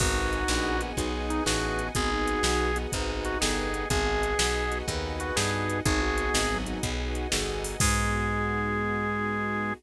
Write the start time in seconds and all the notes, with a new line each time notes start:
0.00 G#1 B3 D#4 F#4 G#4 B4 D#5 F#5 G#5, kick, crash
0.16 B3 D#4 F#4 G#4
0.33 closed hi-hat
0.48 A#1, snare
0.81 B3 D#4 F#4 G#4, closed hi-hat
0.97 B1 B3 D#4 F#4 G#4, kick, closed hi-hat
1.30 D#4, closed hi-hat
1.46 A1 B3 D#4 F#4 G#4, snare
1.79 closed hi-hat
1.94 G#1 B3 D#4 F#4 G#4 B4 D#5 F#5 G#5, kick, closed hi-hat
2.12 B3 D#4 F#4 G#4
2.28 closed hi-hat
2.43 B1, snare
2.76 B3 D#4 F#4 G#4, closed hi-hat
2.92 G#1 B3 D#4 F#4 G#4, kick, closed hi-hat
3.25 F#4, closed hi-hat
3.41 G1 B3 D#4 F#4 G#4, snare
3.74 closed hi-hat
3.90 G#1 B3 D#4 F#4 G#4 B4 D#5 F#5 G#5, kick, closed hi-hat
4.06 B3 D#4 F#4 G#4
4.23 closed hi-hat
4.39 B1, snare
4.72 B3 D#4 F#4 G#4, closed hi-hat
4.88 D#2 B3 D#4 F#4 G#4 B4, kick, closed hi-hat
5.20 F#4, closed hi-hat
5.36 G2 B3 D#4 F#4 G#4, snare
5.70 closed hi-hat
5.85 G#1 B3 D#4 F#4 G#4 B4 D#5 F#5 G#5, kick, closed hi-hat
6.02 B3 D#4 F#4 G#4
6.18 closed hi-hat
6.34 G#1, snare
6.52 F#3
6.66 B3 D#4 F#4 G#4, closed hi-hat
6.83 B1 B3 D#4 F#4 G#4, kick, closed hi-hat
7.15 closed hi-hat
7.32 G1 B3 D#4 F#4 G#4, snare
7.64 open hi-hat
7.80 G#2 G#3 B3 D#4 F#4 G#4, kick, crash